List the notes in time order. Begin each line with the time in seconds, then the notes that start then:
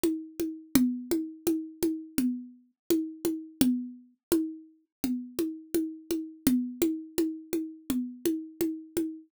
0.04 high conga
0.40 high conga
0.75 low conga
1.11 high conga
1.47 high conga
1.83 high conga
2.18 low conga
2.90 high conga
3.25 high conga
3.61 low conga
4.32 high conga
5.04 low conga
5.39 high conga
5.75 high conga
6.11 high conga
6.47 low conga
6.82 high conga
7.18 high conga
7.53 high conga
7.90 low conga
8.26 high conga
8.61 high conga
8.97 high conga